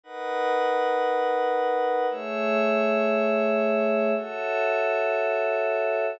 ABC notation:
X:1
M:4/4
L:1/8
Q:1/4=117
K:C#m
V:1 name="Pad 5 (bowed)"
[D^ABf]8 | [A,Gce]8 | [FAce]8 |]